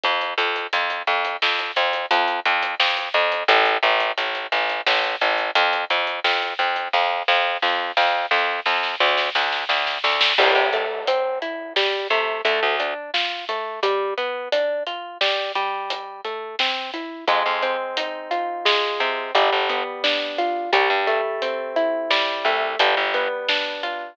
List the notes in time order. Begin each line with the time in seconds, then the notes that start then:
0.04 F2, kick, closed hi-hat
0.21 closed hi-hat
0.38 F2, closed hi-hat
0.56 closed hi-hat
0.73 F2, closed hi-hat
0.90 closed hi-hat
1.07 F2, closed hi-hat
1.25 closed hi-hat
1.42 F2, snare
1.59 closed hi-hat
1.76 F2, closed hi-hat
1.93 closed hi-hat
2.11 F2, closed hi-hat
2.28 closed hi-hat
2.46 F2, closed hi-hat
2.63 closed hi-hat
2.80 F2, snare
2.97 closed hi-hat
3.14 F2, closed hi-hat
3.32 closed hi-hat
3.48 A1, kick, closed hi-hat
3.66 closed hi-hat
3.83 A1, closed hi-hat
4.00 closed hi-hat
4.18 A1, closed hi-hat
4.35 closed hi-hat
4.52 A1, closed hi-hat
4.69 closed hi-hat
4.86 A1, snare
5.04 closed hi-hat
5.21 A1, closed hi-hat
5.38 closed hi-hat
5.55 F2, closed hi-hat
5.73 closed hi-hat
5.90 F2, closed hi-hat
6.07 closed hi-hat
6.24 F2, snare
6.42 closed hi-hat
6.59 F2, closed hi-hat
6.76 closed hi-hat
6.93 F2, kick, snare
7.28 F2, snare
7.62 F2, snare
7.97 F2, snare
8.31 F2, snare
8.66 F2, snare
8.83 snare
9.00 D2, snare
9.18 snare
9.35 D2, snare
9.52 snare
9.69 D2, snare
9.87 snare
10.04 D2, snare
10.21 snare
10.38 C2 G3, kick, crash
10.55 C3
10.73 A3, closed hi-hat
11.07 C4, closed hi-hat
11.42 E4, closed hi-hat
11.76 G3, snare
12.10 C3 A3, closed hi-hat
12.45 D2 A3, closed hi-hat
12.63 D2
12.80 D4, closed hi-hat
13.14 F4, snare
13.49 A3, closed hi-hat
13.83 G3, kick, closed hi-hat
14.18 B3, closed hi-hat
14.52 D4, closed hi-hat
14.87 F4, closed hi-hat
15.21 G3, snare
15.55 G3, closed hi-hat
15.90 closed hi-hat
16.25 A3, closed hi-hat
16.59 C4, snare
16.94 E4, closed hi-hat
17.28 F2 G#3, kick, closed hi-hat
17.46 F2
17.62 C4, closed hi-hat
17.97 D#4, closed hi-hat
18.31 F4, closed hi-hat
18.65 G#3, snare
19.00 C3 C4, closed hi-hat
19.35 G1 G3, closed hi-hat
19.52 G1
19.69 B3, closed hi-hat
20.04 D4, snare
20.38 F4, closed hi-hat
20.73 C2 G3, kick, closed hi-hat
20.90 G2
21.07 A3, closed hi-hat
21.42 C4, closed hi-hat
21.76 E4, closed hi-hat
22.10 G3, snare
22.45 C2 A3, closed hi-hat
22.79 G1 G3, closed hi-hat
22.97 G1
23.14 B3, closed hi-hat
23.49 D4, snare
23.83 F4, closed hi-hat